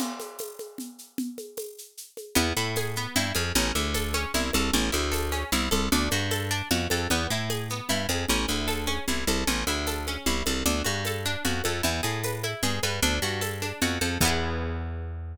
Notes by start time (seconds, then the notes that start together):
0.00 crash, low conga, shaker
0.20 high conga, shaker
0.39 tambourine, high conga, shaker
0.59 high conga, shaker
0.78 low conga, shaker
0.99 shaker
1.18 low conga, shaker
1.38 high conga, shaker
1.57 tambourine, high conga, shaker
1.78 shaker
1.97 shaker
2.17 high conga, shaker
2.35 E2 B3, low conga, shaker
2.57 A2 E4, shaker
2.76 G#4, tambourine, high conga, shaker
2.95 B3, shaker
3.16 G2 E4, low conga, shaker
3.35 F2 G#4, high conga, shaker
3.55 A1 C#4, low conga, shaker
3.75 D2 E4, high conga, shaker
3.94 A4, tambourine, high conga, shaker
4.14 C#4, high conga, shaker
4.34 C2 E4, low conga, shaker
4.53 C2 A4, high conga, shaker
4.73 A1 C#4, low conga, shaker
4.92 D2 E4, high conga, shaker
5.12 A4, tambourine, high conga, shaker
5.32 C#4, high conga, shaker
5.52 C2 E4, low conga, shaker
5.71 C2 A4, high conga, shaker
5.92 D2 D4, low conga, shaker
6.11 G2 F#4, high conga, shaker
6.31 A4, tambourine, high conga, shaker
6.51 D4, shaker
6.71 F2 F#4, low conga, shaker
6.90 F2 A4, high conga, shaker
7.10 E2 B3, low conga, shaker
7.30 A2 E4, shaker
7.50 G#4, tambourine, high conga, shaker
7.69 B3, shaker
7.89 G2 E4, low conga, shaker
8.09 F2 G#4, high conga, shaker
8.29 A1 C#4, low conga, shaker
8.48 D2 E4, high conga, shaker
8.68 A4, tambourine, high conga, shaker
8.87 C#4, high conga, shaker
9.08 C2 E4, low conga, shaker
9.27 C2 A4, high conga, shaker
9.47 A1 C#4, low conga, shaker
9.67 D2 E4, high conga, shaker
9.87 A4, tambourine, high conga, shaker
10.07 C#4, high conga, shaker
10.26 C2 E4, low conga, shaker
10.46 C2 A4, high conga, shaker
10.66 D2 D4, low conga, shaker
10.84 G2 F#4, high conga, shaker
11.05 A4, tambourine, high conga, shaker
11.25 D4, shaker
11.45 F2 F#4, low conga, shaker
11.64 F2 A4, high conga, shaker
11.83 E2 E4, low conga, shaker
12.03 A2 G#4, shaker
12.24 B4, tambourine, high conga, shaker
12.43 E4, high conga, shaker
12.63 G2 G#4, low conga, shaker
12.83 G2 B4, high conga, shaker
13.02 D2 D4, low conga, shaker
13.22 G2 F#4, shaker
13.41 A4, tambourine, high conga, shaker
13.62 D4, high conga, shaker
13.81 F2 F#4, low conga, shaker
14.01 F2 A4, high conga, shaker
14.21 E2 B3, kick, crash
14.25 E4 G#4